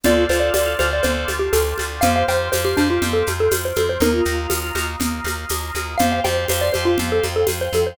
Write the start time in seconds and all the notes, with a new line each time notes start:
0.04 D2 C4 D4 F4 A4 C5 D5 F5, low conga, shaker
0.29 D2 F4 A4 C5 D5 F5, shaker
0.40 D5
0.54 D2 A4 C5 D5 F5, tambourine, high conga, shaker
0.66 F4
0.79 D2 F4 A4 C5 D5 F5, high conga, shaker
0.91 A4 C5 D5 F5
1.03 D2 C5, low conga, shaker
1.28 D2, high conga, shaker
1.39 G4
1.53 D2 A4, tambourine, high conga, shaker
1.78 D2, high conga, shaker
2.01 F2 C4 F4 G4 C5 F5, low conga, shaker
2.16 F5
2.28 F2 G4 C5 F5 G5, shaker
2.52 F2 G4 C5 F5, tambourine, high conga, shaker
2.65 G4 C5
2.77 F2 D4 G4 C5 F5, high conga, shaker
2.89 F4 G4 C5 F5
3.02 F2, low conga, shaker
3.13 A4
3.27 F2, high conga, shaker
3.40 A4
3.51 F2, tambourine, high conga, shaker
3.65 C5
3.76 F2 A4, high conga, shaker
3.89 C5
4.00 D#2 A#3 D#4 F4 A#4, low conga, shaker
4.14 F4
4.25 D#2, shaker
4.50 D#2, tambourine, high conga, shaker
4.75 D#2, high conga, shaker
5.00 D#2, low conga, shaker
5.24 D#2, high conga, shaker
5.49 D#2, tambourine, high conga, shaker
5.75 D#2, high conga, shaker
5.98 F2 G4 C5 F5 G5, low conga, shaker
6.12 F5
6.24 F2 G4 C5 F5 G5, high conga, shaker
6.48 F2 G4 C5 F5, tambourine, high conga, shaker
6.61 C5 D5
6.73 F2 G4 C5 F5, high conga, shaker
6.85 F4 G4 C5 F5
6.98 F2, low conga, shaker
7.12 A4
7.23 F2, high conga, shaker
7.36 A4
7.47 F2, tambourine, high conga, shaker
7.61 C5
7.73 F2 A4, high conga, shaker
7.86 C5